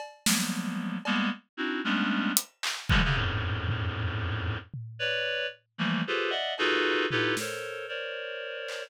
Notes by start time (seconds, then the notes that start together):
0.00 cowbell
0.26 F3 F#3 G3 G#3 A#3 B3, snare
1.05 G3 G#3 A#3 B3, cowbell
1.57 C4 D4 D#4 E4 F#4
1.84 G3 G#3 A3 B3 C#4 D4
2.37 closed hi-hat
2.63 clap
2.89 C3 D3 E3 F3 G3 G#3, kick
3.04 C3 C#3 D3
3.15 E2 F2 F#2 G#2 A2
3.68 floor tom
4.74 floor tom
4.99 B4 C#5 D5
5.78 E3 F3 G3 A3 A#3
6.07 F4 G4 G#4 A4 B4 C5
6.30 D5 D#5 E5 F#5
6.58 D#4 F4 F#4 G#4 A4 B4, cowbell
7.11 D#4 E4 F4 G4 A4 B4, floor tom
7.37 A4 A#4 C5 C#5, snare
7.88 A#4 C5 C#5 D5
8.68 clap